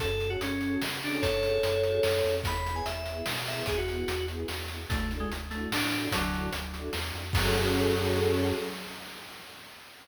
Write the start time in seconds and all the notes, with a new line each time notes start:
0.00 F#2 C#4 F#4 G#4 A4, kick, closed hi-hat
0.20 C#4 F#4 G#4 A4, closed hi-hat
0.30 F#4
0.41 F#2 C#4, closed hi-hat
0.61 C#4 F#4 G#4 A4, closed hi-hat
0.82 C#3, snare
1.02 C#4 D4 F#4 G#4 A4, open hi-hat
1.22 F#2 A4 C#5, kick, closed hi-hat
1.43 C#4 F#4 G#4 A4, closed hi-hat
1.63 F#2, closed hi-hat
1.83 C#4 F#4 G#4 A4, closed hi-hat
2.03 F#2, snare
2.24 F2 C#4 F#4 G#4 A4, closed hi-hat
2.44 E2 B3 E4 G#4 B5, kick, closed hi-hat
2.65 B3 E4 G#4, closed hi-hat
2.76 G#5
2.86 E2 E5, closed hi-hat
3.06 B3 E4 G#4, closed hi-hat
3.26 B2, snare
3.45 B3 E4 G#4 E5, open hi-hat
3.66 E2 G#4, kick, closed hi-hat
3.77 F#4
3.87 B3 E4 G#4, closed hi-hat
4.08 E2, closed hi-hat
4.28 B3 E4 G#4, closed hi-hat
4.48 E2, snare
4.68 B3 E4 G#4, closed hi-hat
4.89 D2 A3 D4 E4 F#4 A4, kick, closed hi-hat
5.10 D4 E4 F#4 A4, closed hi-hat
5.20 G#3
5.31 D2, closed hi-hat
5.50 A3 D4 E4 F#4 A4, closed hi-hat
5.71 A2 D4, snare
5.91 D4 E4 F#4 A4, closed hi-hat
6.12 D2 D3 F#3, kick, closed hi-hat
6.33 D4 E4 F#4 A4, closed hi-hat
6.53 D2, closed hi-hat
6.74 D4 E4 F#4 A4, closed hi-hat
6.93 E2, snare
7.14 F2 D4 E4 F#4 A4, closed hi-hat
7.33 F#2 F#3 C#4 F#4 G#4 A4, kick, crash